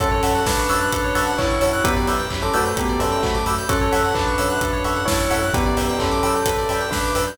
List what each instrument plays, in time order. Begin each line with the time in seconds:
0.00 synth bass 2 F#2, tubular bells C#4 A4, electric piano 2 A4, electric piano 1 C#5 E5 F#5 A5, kick, closed hi-hat
0.11 electric piano 2 C#5
0.23 synth bass 2 F#2, electric piano 1 C#5 E5 F#5 A5, electric piano 2 E5, open hi-hat
0.35 electric piano 2 F#5
0.46 synth bass 2 F#2, tubular bells D4 B4, electric piano 2 A5, kick, snare
0.58 electric piano 2 C#6
0.69 synth bass 2 F#2, electric piano 1 C#5 E5 F#5 A5, electric piano 2 E6, open hi-hat
0.81 electric piano 2 F#6
0.92 synth bass 2 F#2, electric piano 2 A4, kick, closed hi-hat
1.04 electric piano 2 C#5
1.15 synth bass 2 F#2, electric piano 1 C#5 E5 F#5 A5, electric piano 2 E5, open hi-hat
1.27 electric piano 2 F#5
1.38 synth bass 2 F#2, tubular bells E4 C#5, electric piano 2 A5, kick, clap
1.50 electric piano 2 C#6
1.61 synth bass 2 F#2, electric piano 1 C#5 E5 F#5 A5, electric piano 2 E6, open hi-hat
1.73 electric piano 2 F#6
1.84 synth bass 2 F#2, tubular bells B3 G4, electric piano 2 B4, electric piano 1 B4 D5 E5 G5, kick, closed hi-hat
1.97 electric piano 2 D5
2.07 synth bass 2 F#2, electric piano 1 B4 D5 E5 G5, electric piano 2 E5, open hi-hat
2.19 electric piano 2 G5
2.30 synth bass 2 F#2, electric piano 2 B5, kick, clap
2.42 tubular bells C#4 A4, electric piano 2 D6
2.54 synth bass 2 F#2, tubular bells A3 F#4, electric piano 1 B4 D5 E5 G5, electric piano 2 E6, open hi-hat
2.65 electric piano 2 G6
2.77 synth bass 2 F#2, tubular bells B3 G4, electric piano 2 B4, kick, closed hi-hat
2.89 electric piano 2 D5
2.99 synth bass 2 F#2, tubular bells C#4 A4, electric piano 1 B4 D5 E5 G5, electric piano 2 E5, open hi-hat
3.12 electric piano 2 G5
3.23 synth bass 2 F#2, tubular bells A3 F#4, electric piano 2 B5, kick, clap
3.35 electric piano 2 D6
3.46 synth bass 2 F#2, electric piano 1 B4 D5 E5 G5, electric piano 2 E6, open hi-hat
3.58 electric piano 2 G6
3.69 synth bass 2 F#2, tubular bells C#4 A4, electric piano 1 A4 C#5 E5 F#5, electric piano 2 A4, kick, closed hi-hat
3.81 electric piano 2 C#5
3.92 synth bass 2 F#2, electric piano 1 A4 C#5 E5 F#5, electric piano 2 E5, open hi-hat
4.04 electric piano 2 F#5
4.14 synth bass 2 F#2, tubular bells D4 B4, electric piano 2 A5, kick, clap
4.27 electric piano 2 C#6
4.38 synth bass 2 F#2, electric piano 1 A4 C#5 E5 F#5, electric piano 2 E6, open hi-hat
4.50 electric piano 2 F#6
4.61 synth bass 2 F#2, electric piano 2 A4, kick, closed hi-hat
4.73 electric piano 2 C#5
4.84 synth bass 2 F#2, electric piano 1 A4 C#5 E5 F#5, electric piano 2 E5, open hi-hat
4.96 electric piano 2 F#5
5.06 synth bass 2 F#2, tubular bells E4 C#5, electric piano 2 A5, kick, snare
5.20 electric piano 2 C#6
5.30 synth bass 2 F#2, electric piano 1 A4 C#5 E5 F#5, electric piano 2 E6, open hi-hat
5.42 electric piano 2 F#6
5.53 synth bass 2 F#2, tubular bells B3 G4, electric piano 2 B4, electric piano 1 B4 D5 E5 G5, kick, closed hi-hat
5.66 electric piano 2 D5
5.77 synth bass 2 F#2, electric piano 1 B4 D5 E5 G5, electric piano 2 E5, open hi-hat
5.89 electric piano 2 G5
5.98 synth bass 2 F#2, tubular bells C#4 A4, electric piano 2 B5, kick, clap
6.11 electric piano 2 D6
6.23 synth bass 2 F#2, electric piano 1 B4 D5 E5 G5, electric piano 2 E6, open hi-hat
6.35 electric piano 2 G6
6.46 synth bass 2 F#2, electric piano 2 B4, kick, closed hi-hat
6.58 electric piano 2 D5
6.69 synth bass 2 F#2, electric piano 1 B4 D5 E5 G5, electric piano 2 E5, open hi-hat
6.81 electric piano 2 G5
6.91 synth bass 2 F#2, tubular bells D4 B4, electric piano 2 B5, kick, snare
7.04 electric piano 2 D6
7.15 synth bass 2 F#2, electric piano 1 B4 D5 E5 G5, electric piano 2 E6, open hi-hat
7.27 electric piano 2 G6